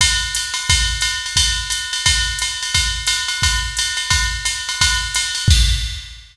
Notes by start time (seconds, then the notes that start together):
0.01 kick, ride
0.35 hi-hat pedal, ride
0.54 ride
0.69 kick, ride
1.01 hi-hat pedal, ride
1.26 ride
1.36 kick, ride
1.70 hi-hat pedal, ride
1.93 ride
2.06 kick, ride
2.39 hi-hat pedal, ride
2.62 ride
2.74 kick, ride
3.07 hi-hat pedal, ride
3.28 ride
3.42 kick, ride
3.77 hi-hat pedal, ride
3.97 ride
4.10 kick, ride
4.45 hi-hat pedal, ride
4.69 ride
4.81 kick, ride
5.14 hi-hat pedal, ride
5.35 ride
5.48 kick, crash